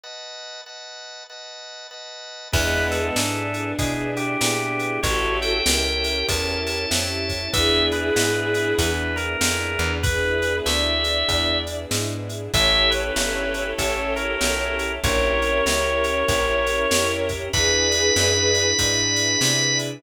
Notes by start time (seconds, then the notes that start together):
0.04 B4 D#5 F#5 A5
0.66 B4 D#5 F#5 A5
1.29 B4 D#5 F#5 A5
1.91 B4 D#5 F#5 A5
2.52 E2 G#3 B3 D4 E4 G#4 B4, kick, crash
2.91 A4, ride
3.16 G#2 B3 D4 E4 G#4, snare
3.54 ride
3.79 B2 B3 D4 E4 G#4, kick, ride
4.16 G4, ride
4.41 A#2 B3 D4 E4 G#4, snare
4.79 ride
5.03 A1 C#4 E4 F#4 G4 A4 C#5, kick, ride
5.42 G5, ride
5.66 C#2 C#4 E4 G4 A4 A#4, snare
6.04 ride
6.28 E2 C#4 E4 G4 A4 A5, kick, ride
6.66 A5, ride
6.90 F2 C#4 E4 G4 A4, snare
7.29 kick, ride
7.52 E2 B3 D4 E4 G#4 E5, kick, ride
7.91 B4, ride
8.16 G#2 B3 D4 E4 G#4, snare
8.54 ride
8.78 E2 B3 D4 E4 G#4 B4, kick, ride
9.16 A#4, ride
9.41 F2 B3 D4 E4 G#4, snare
9.79 E2, ride
10.03 B3 D4 E4 G#4 B4, kick, ride
10.42 ride
10.66 D2 D5 E5, snare
11.04 ride
11.29 E2, kick, ride
11.67 ride
11.91 G#2, snare
12.29 ride
12.53 A1 C#4 E4 G4 A4 C#5 E5, kick, ride
12.90 B4, ride
13.16 G1 C#4 E4 G4 A4, snare
13.54 ride
13.78 A1 C#4 E4 G4 A4, kick, ride
14.16 A#4, ride
14.41 B1 C#4 E4 G4 A4, snare
14.79 ride
15.03 A#1 C#4 E4 G4 A#4 C#5, kick, ride
15.42 ride
15.65 C#2 C#4 E4 G4 A#4, snare
16.04 ride
16.28 A#1 C#4 E4 G4 A#4, kick, ride
16.66 ride
16.91 F2 C#4 E4 G4 A#4, snare
17.29 kick, ride
17.53 E2 D4 E4 G#4 B4 B5, kick, ride
17.91 ride
18.16 F#2 D4 E4 G#4 B4, snare
18.54 ride
18.79 G#2 D4 E4 G#4 B4, kick, ride
19.16 ride
19.41 C3 D4 E4 G#4 B4, snare
19.79 ride